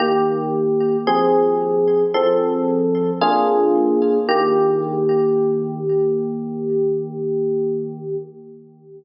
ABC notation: X:1
M:4/4
L:1/8
Q:1/4=56
K:Eb
V:1 name="Electric Piano 1"
[E,B,G]2 [F,CA]2 [F,C=A]2 [B,DF_A]2 | [E,B,G]8 |]